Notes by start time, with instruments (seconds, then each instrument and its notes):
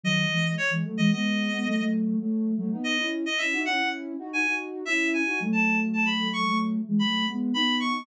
0.04 ocarina D#3 F#3, clarinet D#5
0.31 ocarina E3 G#3
0.58 clarinet C#5
0.70 ocarina E3 G#3
0.85 ocarina F#3 A3
0.98 ocarina E3 G#3, clarinet D#5
1.11 ocarina G#3 B3, clarinet D#5
1.51 ocarina G#3 B3
1.66 ocarina F#3 A3
1.78 ocarina F#3 A3
2.19 ocarina F#3 A3
2.57 ocarina F#3 A3
2.72 ocarina B3 D#4
2.84 clarinet D#5
2.98 ocarina C#4 E4
3.26 clarinet D#5
3.38 ocarina C#4 E4, clarinet E5
3.52 ocarina D#4 F#4
3.65 ocarina C#4 E4, clarinet F#5
3.79 ocarina C#4 E4
4.19 ocarina D#4 F#4
4.32 ocarina D#4 F#4, clarinet G#5
4.47 ocarina D#4 F#4
4.85 ocarina C#4 E4, clarinet E5
5.14 clarinet G#5
5.26 ocarina D#4 F#4
5.40 ocarina F#3 A3
5.53 clarinet A5
5.93 clarinet A5
6.06 clarinet B5
6.33 clarinet C#6
6.46 ocarina F#3 A3
6.87 ocarina E3 G#3
6.99 ocarina F#3 A3, clarinet B5
7.28 ocarina G#3 B3
7.54 ocarina B3 D#4, clarinet B5
7.80 clarinet C#6